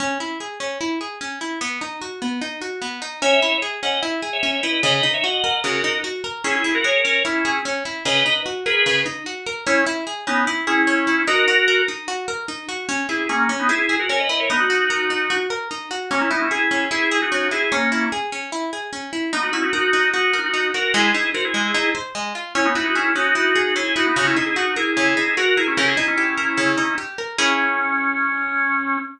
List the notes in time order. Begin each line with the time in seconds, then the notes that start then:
0.00 C#4
0.20 E4
0.40 G#4
0.60 C#4
0.81 E4
1.01 G#4
1.21 C#4
1.41 E4
1.61 B3
1.81 D#4
2.02 F#4
2.22 B3
2.41 D#4
2.61 F#4
2.82 B3
3.02 D#4
3.22 C#4 C#5 E5
3.42 E4
3.62 G#4
3.83 C#4 D#5 F#5
4.03 E4
4.22 G#4
4.33 C#5 E5
4.43 C#4
4.63 E4 B4 D#5
4.83 C#3 B4 D#5
4.93 B4 D#5
5.03 D#4
5.13 C#5 E5
5.23 F#4 D#5 F#5
5.44 A#4
5.64 C#3 F#4 A#4
5.84 D#4
6.04 F#4
6.24 A#4
6.44 C#4 E4 G#4
6.55 E4 G#4
6.64 E4
6.74 F#4 A#4
6.84 G#4 A#4 C#5
7.05 C#4
7.25 C#4 E4
7.45 G#4
7.65 C#4
7.85 E4
8.05 C#3 B4 D#5
8.26 D#4
8.46 F#4
8.66 G#4 A#4 B4
8.86 C#3
9.06 D#4
9.26 F#4
9.46 A#4
9.67 C#4 E4
9.86 E4
10.07 G#4
10.27 B3 C#4 D#4
10.47 E4
10.67 C#4 E4 G#4
10.87 C#4
11.07 E4
11.27 D#4 F#4 A#4
11.48 F#4
11.68 A#4
11.88 D#4
12.08 F#4
12.28 A#4
12.48 D#4
12.69 F#4
12.89 C#4
13.09 E4 G#4
13.29 A#3 C#4 G#4
13.49 C#4
13.59 B3 D#4
13.69 E4 G#4
13.89 G#4
13.99 F#4 A#4
14.09 C#4 A#4 C#5
14.19 B4 D#5
14.29 E4 B4 D#5
14.39 A#4 C#5
14.50 B3 D#4
14.60 D#4 F#4
14.70 F#4
14.90 A#4
15.10 D#4
15.30 F#4
15.50 A#4
15.71 D#4
15.91 F#4
16.11 A#3 C#4
16.21 C#4 E4
16.31 B3 D#4 E4
16.41 C#4 E4
16.51 E4 G#4
16.71 C#4
16.91 E4 G#4
17.11 G#4
17.22 D#4 F#4
17.32 C#4
17.51 E4 G#4
17.72 A#3 C#4
17.92 E4
18.12 G#4
18.32 C#4
18.52 E4
18.73 G#4
18.93 C#4
19.13 E4
19.33 B3 D#4
19.43 D#4 F#4
19.53 C#4 E4 F#4
19.63 D#4 F#4
19.73 D#4 F#4 A#4
19.93 D#4
20.14 D#4 F#4
20.33 A#4
20.44 D#4 F#4
20.54 D#4
20.74 F#4 A#4
20.94 G#3 E4 G#4
21.15 D#4
21.34 F#4 A#4 C5
21.44 E4 G#4
21.54 G#3
21.74 D#4
21.95 C5
22.15 G#3
22.35 F4
22.55 C#4 E4
22.65 B3 D#4
22.75 D#4 E4 F#4
22.85 D#4 F#4
22.95 C#4 E4 G#4
23.15 C#4 D#4 F#4
23.35 E4
23.56 G#4
23.76 C#4 E4 G#4
23.96 D#4 E4 F#4
24.06 B3 D#4
24.16 C#3 D#4 F#4
24.26 C#4 E4
24.36 D#4 E4 G#4
24.46 E4 G#4
24.56 D#4 F#4
24.76 E4 G#4 A#4
24.97 C#3
25.17 D#4
25.37 F#4 A#4
25.57 E4 G#4 A#4
25.67 C#4 E4
25.77 C#3 G4 A#4
25.88 E4 G#4
25.97 D#4
26.08 C#4 E4
26.18 G4
26.38 A#4
26.57 C#3
26.78 D#4
26.98 G4
27.18 A#4
27.38 C#4 E4 G#4